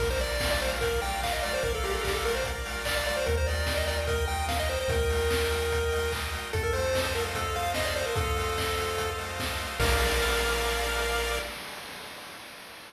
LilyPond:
<<
  \new Staff \with { instrumentName = "Lead 1 (square)" } { \time 4/4 \key bes \major \tempo 4 = 147 bes'16 c''16 d''8. d''16 c''16 r16 bes'8 g''8 f''16 ees''16 d''16 c''16 | bes'16 a'16 g'16 a'16 g'16 a'16 bes'16 c''16 r4 d''16 d''16 d''16 c''16 | bes'16 c''16 d''8. ees''16 d''16 r16 bes'8 g''8 f''16 ees''16 c''16 c''16 | bes'2.~ bes'8 r8 |
a'16 bes'16 c''8. c''16 bes'16 r16 a'8 f''8 ees''16 d''16 c''16 bes'16 | a'2~ a'8 r4. | bes'1 | }
  \new Staff \with { instrumentName = "Lead 1 (square)" } { \time 4/4 \key bes \major bes'8 d''8 f''8 bes'8 d''8 f''8 bes'8 d''8 | f''8 bes'8 d''8 f''8 bes'8 d''8 f''8 bes'8 | bes'8 ees''8 g''8 bes'8 ees''8 g''8 bes'8 ees''8 | g''8 bes'8 ees''8 g''8 bes'8 ees''8 g''8 bes'8 |
a'8 c''8 ees''8 f''8 a'8 c''8 ees''8 f''8 | a'8 c''8 ees''8 f''8 a'8 c''8 ees''8 f''8 | <bes' d'' f''>1 | }
  \new Staff \with { instrumentName = "Synth Bass 1" } { \clef bass \time 4/4 \key bes \major bes,,1 | bes,,1 | ees,1 | ees,1 |
f,1 | f,1 | bes,,1 | }
  \new DrumStaff \with { instrumentName = "Drums" } \drummode { \time 4/4 <cymc bd>4 <hho bd sn>8 hho8 <hh bd>8 hho8 <hc bd>8 hho8 | <hh bd>8 hho8 <hc bd>8 hho8 <hh bd>8 hho8 <hc bd>8 hho8 | <hh bd>8 hho8 <bd sn>8 hho8 <hh bd>8 hho8 <bd sn>8 sn8 | <hh bd>8 hho8 <bd sn>8 hho8 <hh bd>8 hho8 <hc bd>8 hho8 |
<hh bd>8 hho8 <bd sn>8 hho8 <hh bd>8 hho8 <bd sn>8 hho8 | <hh bd>8 hho8 <bd sn>8 hho8 <hh bd>8 hho8 <bd sn>8 hho8 | <cymc bd>4 r4 r4 r4 | }
>>